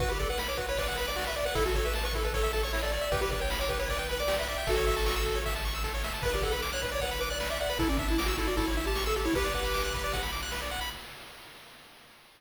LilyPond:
<<
  \new Staff \with { instrumentName = "Lead 1 (square)" } { \time 4/4 \key b \minor \tempo 4 = 154 b'16 g'16 a'16 b'16 r16 cis''16 b'16 cis''16 b'8 b'16 d''8 e''16 d''16 b'16 | a'16 fis'16 a'16 b'16 r16 b'16 a'16 b'16 a'8 a'16 cis''8 d''16 d''16 d''16 | b'16 g'16 b'16 cis''16 r16 cis''16 b'16 cis''16 b'8 b'16 d''8 e''16 e''16 e''16 | <fis' a'>2 r2 |
b'16 g'16 a'16 b'16 r16 cis''16 b'16 cis''16 b'8 b'16 d''8 e''16 d''16 b'16 | e'16 cis'16 d'16 e'16 r16 fis'16 e'16 fis'16 e'8 e'16 g'8 a'16 g'16 e'16 | <g' b'>2~ <g' b'>8 r4. | }
  \new Staff \with { instrumentName = "Lead 1 (square)" } { \time 4/4 \key b \minor fis'16 b'16 d''16 fis''16 b''16 d'''16 fis'16 b'16 d''16 fis''16 b''16 d'''16 fis'16 b'16 d''16 fis''16 | e'16 a'16 cis''16 e''16 a''16 cis'''16 e'16 a'16 cis''16 e''16 a''16 cis'''16 e'16 a'16 cis''16 e''16 | g'16 b'16 d''16 g''16 b''16 d'''16 g'16 b'16 d''16 g''16 b''16 d'''16 g'16 b'16 d''16 g''16 | a'16 cis''16 e''16 a''16 cis'''16 e'''16 a'16 cis''16 e''16 a''16 cis'''16 e'''16 a'16 cis''16 e''16 a''16 |
b'16 d''16 fis''16 b''16 d'''16 fis'''16 b'16 d''16 fis''16 b''16 d'''16 fis'''16 b'16 d''16 fis''16 b''16 | a'16 d''16 e''16 a''16 d'''16 e'''16 a'16 d''16 a'16 cis''16 e''16 a''16 cis'''16 e'''16 a'16 cis''16 | b'16 d''16 fis''16 b''16 d'''16 fis'''16 b'16 d''16 fis''16 b''16 d'''16 fis'''16 b'16 d''16 fis''16 b''16 | }
  \new Staff \with { instrumentName = "Synth Bass 1" } { \clef bass \time 4/4 \key b \minor b,,1 | a,,1 | b,,1 | a,,1 |
b,,1 | a,,2 a,,2 | b,,1 | }
  \new DrumStaff \with { instrumentName = "Drums" } \drummode { \time 4/4 <bd cymr>8 <bd cymr>8 sn8 <bd cymr>8 <bd cymr>8 cymr8 sn8 cymr8 | <bd cymr>8 <bd cymr>8 sn8 <bd cymr>8 <bd cymr>8 cymr8 sn8 cymr8 | <bd cymr>8 <bd cymr>8 sn8 <bd cymr>8 <bd cymr>8 cymr8 sn8 cymr8 | <bd cymr>8 <bd cymr>8 sn8 <bd cymr>8 <bd cymr>8 cymr8 <bd sn>8 sn8 |
<cymc bd>8 <bd cymr>8 sn8 <bd cymr>8 <bd cymr>8 cymr8 sn8 cymr8 | <bd cymr>8 <bd cymr>8 sn8 <bd cymr>8 <bd cymr>8 cymr8 sn8 cymr8 | <bd cymr>8 <bd cymr>8 sn8 <bd cymr>8 <bd cymr>8 cymr8 sn8 cymr8 | }
>>